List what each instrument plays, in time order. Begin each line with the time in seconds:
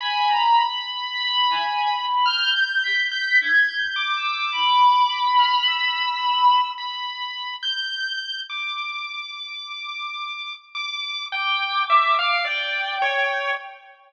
0.00 violin G#5, lead 1 (square) B5
0.27 violin A#5
1.13 violin B5
1.50 violin G#5
1.90 violin B5
2.25 lead 1 (square) F6, violin G6
2.56 lead 1 (square) G6
2.83 violin B6
3.11 lead 1 (square) G6
3.40 lead 1 (square) G6, violin G#6
3.68 lead 1 (square) G6
3.78 violin G6
3.96 lead 1 (square) D6
4.16 violin E6
4.52 violin B5
5.38 lead 1 (square) F6
5.68 lead 1 (square) E6
6.78 lead 1 (square) B5
7.62 lead 1 (square) G6
8.49 lead 1 (square) D6
10.75 lead 1 (square) D6
11.32 lead 1 (square) G5, violin D6
11.89 lead 1 (square) E5
12.19 lead 1 (square) F5
12.45 lead 1 (square) D5, violin G5
13.02 lead 1 (square) C#5